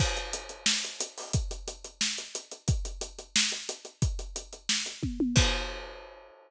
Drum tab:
CC |x-------|--------|--------|--------|
HH |-xxx-xxo|xxxx-xxx|xxxx-xxx|xxxx-x--|
SD |----o---|----o---|----o---|----o---|
T1 |--------|--------|--------|------oo|
BD |o-------|o-------|o-------|o-----o-|

CC |x-------|
HH |--------|
SD |--------|
T1 |--------|
BD |o-------|